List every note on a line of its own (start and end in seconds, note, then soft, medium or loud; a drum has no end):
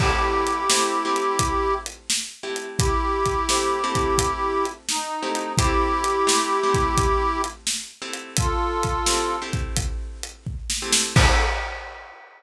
0.00 0.64 A3 loud
0.00 0.64 C4 medium
0.00 0.64 E4 loud
0.00 1.74 E4 loud
0.00 0.64 G4 loud
0.00 1.74 G4 loud
0.00 kick medium
0.00 crash medium
0.47 closed hi-hat medium
0.70 1.02 A3 medium
0.70 1.02 C4 medium
0.70 1.02 E4 medium
0.70 1.02 G4 medium
0.70 snare loud
1.05 2.33 A3 medium
1.05 2.33 C4 medium
1.05 2.33 E4 medium
1.05 2.33 G4 medium
1.16 closed hi-hat medium
1.39 kick medium
1.39 closed hi-hat medium
1.86 closed hi-hat medium
2.10 snare medium
2.43 3.40 A3 medium
2.43 3.40 C4 medium
2.43 3.40 E4 medium
2.43 3.40 G4 medium
2.56 closed hi-hat medium
2.78 4.66 E4 loud
2.78 4.66 G4 loud
2.78 kick medium
2.78 closed hi-hat medium
3.26 kick medium
3.26 closed hi-hat medium
3.49 3.82 A3 medium
3.49 3.82 C4 medium
3.49 3.82 E4 medium
3.49 3.82 G4 medium
3.49 snare medium
3.84 5.12 A3 medium
3.84 5.12 C4 medium
3.84 5.12 E4 medium
3.84 5.12 G4 medium
3.95 kick medium
3.95 closed hi-hat medium
4.18 kick medium
4.18 closed hi-hat medium
4.65 closed hi-hat soft
4.89 5.52 D#4 loud
4.89 snare medium
5.23 5.55 A3 medium
5.23 5.55 C4 medium
5.23 5.55 E4 medium
5.23 5.55 G4 medium
5.35 closed hi-hat medium
5.58 6.23 A3 medium
5.58 6.23 C4 loud
5.58 7.42 E4 loud
5.58 6.23 E4 loud
5.58 7.42 G4 loud
5.58 6.23 G4 loud
5.58 kick medium
5.58 closed hi-hat medium
6.04 closed hi-hat medium
6.27 6.59 A3 loud
6.27 6.59 C4 medium
6.27 6.59 E4 medium
6.27 6.59 G4 medium
6.27 snare medium
6.63 7.92 A3 medium
6.63 7.92 C4 medium
6.63 7.92 E4 medium
6.63 7.92 G4 medium
6.74 kick medium
6.74 closed hi-hat medium
6.98 kick medium
6.98 closed hi-hat medium
7.44 closed hi-hat medium
7.67 snare medium
8.02 8.98 A3 medium
8.02 8.98 C4 medium
8.02 8.98 E4 medium
8.02 8.98 G4 medium
8.14 closed hi-hat medium
8.37 9.36 F4 loud
8.37 9.36 A4 loud
8.37 kick medium
8.37 closed hi-hat medium
8.83 kick medium
8.83 closed hi-hat medium
9.06 9.39 A3 medium
9.06 9.39 C4 medium
9.06 9.39 E4 medium
9.06 9.39 G4 medium
9.06 snare medium
9.42 10.70 A3 medium
9.42 10.70 C4 medium
9.42 10.70 E4 medium
9.42 10.70 G4 medium
9.53 kick medium
9.53 closed hi-hat soft
9.76 kick medium
9.76 closed hi-hat medium
10.23 closed hi-hat medium
10.47 kick medium
10.70 snare medium
10.82 11.14 A3 loud
10.82 11.14 C4 loud
10.82 11.14 E4 medium
10.82 11.14 G4 medium
10.92 snare loud
11.16 11.40 A3 loud
11.16 11.40 C4 loud
11.16 11.40 E4 loud
11.16 11.40 G4 loud
11.16 11.42 A4 loud
11.16 kick loud
11.16 crash loud